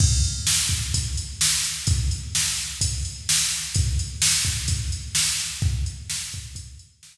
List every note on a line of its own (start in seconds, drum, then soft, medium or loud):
0.00 kick loud
0.00 crash loud
0.24 closed hi-hat medium
0.47 snare loud
0.69 kick loud
0.69 closed hi-hat medium
0.94 kick loud
0.94 closed hi-hat loud
1.17 closed hi-hat medium
1.41 snare loud
1.64 closed hi-hat medium
1.87 kick loud
1.87 closed hi-hat loud
2.11 closed hi-hat medium
2.35 snare loud
2.58 closed hi-hat medium
2.81 kick loud
2.81 closed hi-hat loud
3.05 closed hi-hat medium
3.29 snare loud
3.50 closed hi-hat medium
3.75 kick loud
3.75 closed hi-hat loud
3.99 closed hi-hat medium
4.22 snare loud
4.45 kick medium
4.45 closed hi-hat medium
4.68 kick loud
4.68 closed hi-hat loud
4.92 closed hi-hat medium
5.15 snare loud
5.40 closed hi-hat medium
5.62 kick loud
5.86 closed hi-hat medium
6.10 snare loud
6.32 kick loud
6.32 closed hi-hat medium
6.55 kick loud
6.55 closed hi-hat loud
6.79 closed hi-hat medium
7.03 snare loud